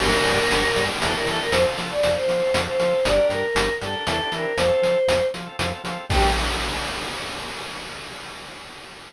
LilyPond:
<<
  \new Staff \with { instrumentName = "Choir Aahs" } { \time 3/4 \key g \dorian \tempo 4 = 118 bes'2 a'16 bes'16 a'16 bes'16 | c''16 r8 d''8 c''4 c''8. | d''8 bes'4 a'8 a'8 bes'8 | c''4. r4. |
g'4 r2 | }
  \new Staff \with { instrumentName = "Drawbar Organ" } { \time 3/4 \key g \dorian <bes d' g'>4.~ <bes d' g'>16 <bes d' g'>16 <c' d' e' g'>16 <c' d' e' g'>16 <c' d' e' g'>8 | <c' f' a'>4.~ <c' f' a'>16 <c' f' a'>16 <c' f' a'>16 <c' f' a'>16 <c' f' a'>8 | <d' g' bes'>4.~ <d' g' bes'>16 <d' g' bes'>16 <c' d' e' g'>16 <c' d' e' g'>16 <c' d' e' g'>8 | <c' f' a'>4.~ <c' f' a'>16 <c' f' a'>16 <c' f' a'>16 <c' f' a'>16 <c' f' a'>8 |
<bes d' g'>4 r2 | }
  \new Staff \with { instrumentName = "Drawbar Organ" } { \clef bass \time 3/4 \key g \dorian g,,8 g,8 g,,8 g,8 e,8 e8 | f,8 f8 f,8 f8 f,8 f8 | g,,8 g,8 g,,8 g,8 e,8 e8 | f,8 f8 f,8 f8 f,8 f8 |
g,4 r2 | }
  \new DrumStaff \with { instrumentName = "Drums" } \drummode { \time 3/4 cymc8 hh8 hh8 hh8 hh8 hh8 | hh8 hh8 hh8 hh8 hh8 hh8 | hh8 hh8 hh8 hh8 hh8 hh8 | hh8 hh8 hh8 hh8 hh8 hh8 |
<cymc bd>4 r4 r4 | }
>>